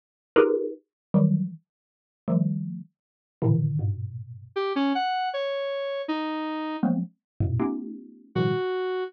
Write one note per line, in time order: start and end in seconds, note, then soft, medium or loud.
0.36 0.70 D#4 loud
0.36 0.70 F4 loud
0.36 0.70 G4 loud
0.36 0.70 G#4 loud
0.36 0.70 A#4 loud
0.36 0.70 B4 loud
1.14 1.48 D#3 loud
1.14 1.48 E3 loud
1.14 1.48 F#3 loud
1.14 1.48 G3 loud
2.28 2.79 D#3 medium
2.28 2.79 F3 medium
2.28 2.79 G3 medium
2.28 2.79 A3 medium
3.42 3.76 A2 loud
3.42 3.76 A#2 loud
3.42 3.76 C3 loud
3.42 3.76 D3 loud
3.42 3.76 D#3 loud
3.42 3.76 E3 loud
3.79 4.47 G2 medium
3.79 4.47 G#2 medium
3.79 4.47 A#2 medium
3.79 4.47 B2 medium
4.56 4.73 G4 loud
4.76 4.93 C#4 loud
4.95 5.29 F#5 loud
5.33 6.02 C#5 medium
6.08 6.77 D#4 loud
6.83 7.00 F3 medium
6.83 7.00 F#3 medium
6.83 7.00 G#3 medium
6.83 7.00 A#3 medium
6.83 7.00 B3 medium
6.83 7.00 C4 medium
7.41 7.58 E2 medium
7.41 7.58 F#2 medium
7.41 7.58 G#2 medium
7.41 7.58 A2 medium
7.41 7.58 A#2 medium
7.41 7.58 B2 medium
7.59 8.28 A3 medium
7.59 8.28 B3 medium
7.59 8.28 C#4 medium
7.59 8.28 D#4 medium
7.59 8.28 F4 medium
7.59 8.28 G4 medium
8.35 8.53 A2 medium
8.35 8.53 B2 medium
8.35 8.53 C#3 medium
8.35 8.53 D#3 medium
8.35 8.53 F3 medium
8.35 8.53 G3 medium
8.35 9.04 F#4 medium